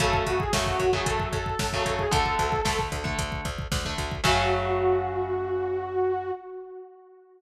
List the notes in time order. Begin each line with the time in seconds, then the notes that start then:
0.00 F#2 C#3 F#3 A3 A4, kick, closed hi-hat
0.13 kick
0.26 F#2 F#4, kick, closed hi-hat
0.39 G#4, kick
0.53 F#2 C#3 F#3 A3, kick, snare
0.66 F#4, kick
0.80 F#2, kick, closed hi-hat
0.93 C#3 F#3 A3 G#4, kick
1.06 F#2 A4, kick, closed hi-hat
1.20 kick
1.33 F#2 A4, kick, closed hi-hat
1.46 kick
1.59 F#2, kick, snare
1.73 C#3 F#3 A3, kick
1.86 F#2 A4, kick, closed hi-hat
1.99 G#4, kick
2.11 D2 D3 A3 A4, kick, closed hi-hat
2.26 kick
2.39 D2, kick, closed hi-hat
2.52 kick
2.65 D2 D3 A3, kick, snare
2.79 kick
2.92 D2, kick, closed hi-hat
3.04 D3 A3, kick
3.18 D2, kick, closed hi-hat
3.32 kick
3.45 D2, kick, closed hi-hat
3.59 kick
3.72 D2, kick, snare
3.85 D3 A3, kick
3.98 D2, kick, closed hi-hat
4.12 kick
4.24 F#2 C#3 F#3 A3 F#4, kick, crash